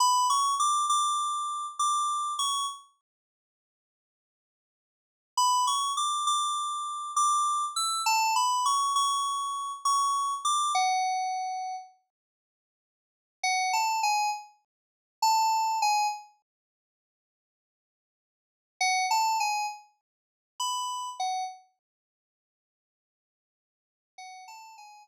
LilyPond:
\new Staff { \time 9/8 \key b \minor \tempo 4. = 67 b''8 cis'''8 d'''8 d'''4. d'''4 cis'''8 | r1 r8 | b''8 cis'''8 d'''8 d'''4. d'''4 e'''8 | a''8 b''8 cis'''8 cis'''4. cis'''4 d'''8 |
fis''2 r2 r8 | \key fis \minor fis''8 a''8 gis''8 r4. a''4 gis''8 | r1 r8 | fis''8 a''8 gis''8 r4. b''4 fis''8 |
r1 r8 | fis''8 a''8 gis''8 r2. | }